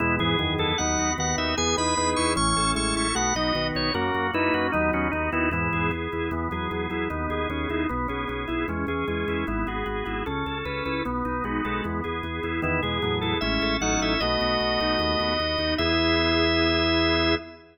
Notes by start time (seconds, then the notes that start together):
0.00 E2 B2 G#3 B3 E4
0.19 E2 G#2 E3 G#4
0.39 E2 F#2 D#3 B3
0.58 E2 E4 A4
0.78 D#2 F#3 B3 D#4 F#5
0.98 D#2 F#4
1.18 D#2 D#3 B3 F#5
1.38 D#2 D#4 E5
1.57 E2 B3 G#4 G#5
1.77 E2 D#4 G#4 B4 B5
1.97 E2 B3 D#4 B4
2.16 E2 E4 C#6
2.36 A1 E3 C#4 C#6
2.56 A1 A4
2.75 A1 G#3 C#4 E4 C#6
2.96 A1 E4 C#6
3.15 B1 A3 B3 F#4 F#5
3.35 B1 F#3 D#4 F#4 D#5
3.55 B1 D#3 B3
3.75 B1 D#4 C#5
3.94 F#2 A#3 C#4 F#4 A#4
4.14 F#2 F#4
4.34 F#2 A#3 D#4 E4 B4
4.54 F#2 C#4 F#4
4.72 D#2 F#3 B3 D#4
4.93 D#2 C#4 F#4
5.12 D#2 B3 D#4
5.32 D#2 D#3 B3 D#4 E4
5.51 E2 G#2 E3 B3 E4
5.73 E2 G#4
5.91 E2 B3
6.12 E2 E4
6.31 E2 E3 B3
6.51 E2 F#3 G#4
6.71 E2 F#3 B3
6.90 E2 F#3 E4
7.10 D#2 B3 D#4
7.30 D#2 G#4
7.50 D#2 B3 C#4
7.69 D#2 D#4 E4
7.89 B1 B3
8.08 B1 C#4 G#4
8.28 B1 B3 C#4
8.48 B1 E4
8.68 E2 G#3 C#4
8.87 E2 E3 G#4
9.07 E2 G#3 C#4
9.28 E2 E4
9.47 G#1 B3 E4
9.67 G#1 F#4 G#4
9.86 G#1 B3 F#4
10.06 G#1 E4 F#4
10.26 C#2 C#4 A4
10.46 C#2 A4
10.65 C#2 C#4 B4
10.85 C#2 E4 B4
11.05 B1 B3
11.25 B1 D#4
11.44 B1 G#3 F#4
11.65 B1 G#3 A4
11.84 E2 B3
12.04 E2 G#4
12.23 E2 B3
12.43 E2 E4
12.62 E2 D#3 B3 E4
12.82 E2 B2 G#3 G#4
13.02 E2 A2 F#3 B3
13.21 E2 E4 A4
13.41 A1 G#3 C#4 E4 E5
13.62 A1 A4
13.81 A1 F#3 C#4 D#4 F#5
14.00 A1 E4 E5
14.20 B1 A3 B3 F#4 D#5
14.41 B1 F#4
14.60 B1 B3
14.80 B1 A3 D#4 F#4
14.99 D#2 B3
15.20 D#2 F#4
15.40 D#2 B3
15.58 D#2 D#4
15.78 E2 B3 E4 G#4 E5